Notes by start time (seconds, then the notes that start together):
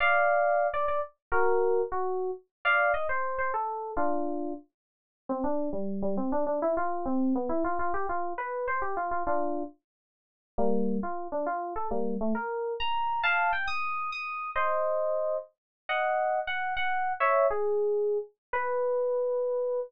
0.00 D5 F5
0.74 D5
0.88 D5
1.32 F#4 A#4
1.92 F#4
2.65 D5 F5
2.94 D#5
3.09 C5
3.38 C5
3.54 A4
3.97 D4 F4
5.29 C4
5.44 D4
5.73 G3
6.02 G3
6.17 C4
6.32 D4
6.47 D4
6.62 E4
6.77 F4
7.06 C4
7.35 B3
7.49 E4
7.64 F4
7.79 F4
7.94 G4
8.09 F4
8.38 B4
8.68 C5
8.82 G4
8.97 F4
9.11 F4
9.27 D4 F4
10.58 G3 A#3
11.03 F4
11.32 D4
11.46 F4
11.76 A4
11.91 G3 A#3
12.21 A3
12.35 A#4
12.80 A#5
13.23 F5 A5
13.53 G5
13.67 D#6
14.12 D#6
14.56 C5 D#5
15.89 D#5 F#5
16.47 F#5
16.77 F#5
17.20 C#5 E5
17.50 G#4
18.53 B4